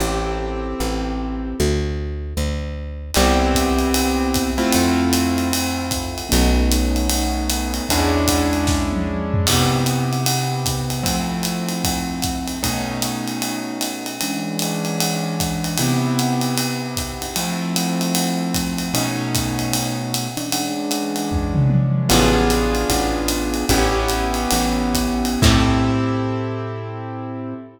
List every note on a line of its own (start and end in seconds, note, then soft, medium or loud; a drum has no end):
0.00 0.75 A1 medium
0.00 1.56 C4 medium
0.00 1.56 E4 medium
0.00 1.56 G4 medium
0.00 1.56 A4 medium
0.80 1.54 A1 medium
1.60 2.34 D2 medium
2.37 3.11 D2 medium
3.14 4.65 C2 loud
3.14 4.50 B3 medium
3.14 4.50 C4 loud
3.14 4.50 E4 loud
3.14 4.50 G4 loud
3.14 crash medium
3.14 ride medium
3.54 kick medium
3.54 hi-hat pedal medium
3.54 ride medium
3.79 ride medium
3.94 ride loud
4.34 kick medium
4.34 hi-hat pedal medium
4.34 ride medium
4.58 6.28 A3 medium
4.58 6.28 C4 loud
4.58 6.28 E4 loud
4.58 6.28 F4 medium
4.58 ride medium
4.73 6.23 F2 medium
4.73 ride loud
5.13 hi-hat pedal medium
5.13 ride medium
5.38 ride medium
5.53 ride loud
5.91 kick medium
5.91 hi-hat pedal medium
5.91 ride medium
6.18 ride medium
6.29 7.81 B1 loud
6.29 7.85 A3 medium
6.29 7.85 B3 medium
6.29 7.85 C#4 loud
6.29 7.85 D#4 loud
6.29 ride loud
6.71 hi-hat pedal medium
6.71 ride medium
6.96 ride medium
7.10 ride loud
7.50 hi-hat pedal medium
7.50 ride medium
7.74 ride medium
7.89 9.38 E2 medium
7.89 9.46 G#3 medium
7.89 9.46 C#4 medium
7.89 9.46 D4 loud
7.89 9.46 E4 loud
7.89 kick medium
7.89 ride loud
8.28 kick medium
8.28 hi-hat pedal medium
8.28 ride medium
8.53 ride medium
8.67 kick medium
8.67 snare medium
8.93 high tom medium
9.34 floor tom loud
9.47 11.04 C3 medium
9.47 11.04 B3 medium
9.47 11.03 E4 medium
9.47 11.04 G4 medium
9.47 kick medium
9.47 crash loud
9.47 ride loud
9.86 hi-hat pedal medium
9.86 ride medium
10.13 ride medium
10.26 ride loud
10.66 kick medium
10.66 hi-hat pedal medium
10.66 ride medium
10.90 ride medium
11.03 12.59 F3 medium
11.03 12.59 A3 medium
11.03 12.59 C4 medium
11.03 12.59 E4 medium
11.03 kick medium
11.03 ride loud
11.43 hi-hat pedal medium
11.43 ride medium
11.69 ride medium
11.84 kick medium
11.84 ride loud
12.22 kick medium
12.22 hi-hat pedal medium
12.22 ride medium
12.48 ride medium
12.63 14.18 B2 medium
12.63 14.18 A3 medium
12.63 14.18 C#4 medium
12.63 14.18 D#4 medium
12.63 kick medium
12.63 ride loud
13.02 hi-hat pedal medium
13.02 ride medium
13.28 ride medium
13.42 ride medium
13.81 hi-hat pedal medium
13.81 ride medium
14.06 ride medium
14.21 15.77 E3 medium
14.21 15.77 G#3 medium
14.21 15.77 C#4 medium
14.21 15.77 D4 medium
14.21 ride medium
14.59 hi-hat pedal medium
14.59 ride medium
14.85 ride medium
15.00 ride loud
15.40 kick medium
15.40 hi-hat pedal medium
15.40 ride medium
15.64 ride medium
15.78 17.35 C3 medium
15.78 17.35 B3 medium
15.78 17.35 E4 medium
15.78 17.35 G4 medium
15.78 ride loud
16.19 hi-hat pedal medium
16.19 ride medium
16.41 ride medium
16.58 ride medium
16.97 kick medium
16.97 hi-hat pedal medium
16.97 ride medium
17.22 ride medium
17.36 18.91 F3 medium
17.36 18.91 A3 medium
17.36 18.91 C4 medium
17.36 18.91 E4 medium
17.36 ride loud
17.76 hi-hat pedal medium
17.76 ride medium
18.01 ride medium
18.15 ride loud
18.54 kick medium
18.54 hi-hat pedal medium
18.54 ride medium
18.78 ride medium
18.94 20.28 B2 medium
18.94 20.28 A3 medium
18.94 20.28 C#4 medium
18.94 20.28 D#4 medium
18.94 ride loud
19.35 kick medium
19.35 hi-hat pedal medium
19.35 ride medium
19.59 ride medium
19.73 ride loud
20.14 hi-hat pedal medium
20.14 ride medium
20.37 22.08 E3 medium
20.37 22.08 G#3 medium
20.37 22.08 C#4 medium
20.37 22.08 D4 medium
20.37 ride medium
20.52 ride loud
20.91 hi-hat pedal medium
20.91 ride medium
21.16 ride medium
21.31 kick medium
21.31 floor tom medium
21.55 mid tom loud
21.70 high tom medium
22.09 22.85 A1 loud
22.09 23.65 B3 medium
22.09 23.65 D4 loud
22.09 23.65 F4 loud
22.09 23.65 G#4 medium
22.09 crash loud
22.09 ride loud
22.50 hi-hat pedal medium
22.50 ride medium
22.75 ride medium
22.90 23.64 A1 medium
22.90 kick medium
22.90 ride medium
23.28 hi-hat pedal medium
23.28 ride medium
23.54 ride medium
23.69 24.47 A1 loud
23.69 25.41 B3 loud
23.69 25.41 C#4 loud
23.69 25.41 E4 medium
23.69 25.41 G4 medium
23.69 kick medium
23.69 ride loud
24.08 hi-hat pedal medium
24.08 ride medium
24.34 ride medium
24.51 25.37 A1 medium
24.51 ride loud
24.94 kick medium
24.94 hi-hat pedal medium
24.94 ride medium
25.25 ride medium
25.42 27.54 A2 loud
25.42 27.54 C4 medium
25.42 27.54 E4 loud
25.42 27.54 G4 medium
25.42 27.54 A4 loud
25.42 kick loud
25.42 crash loud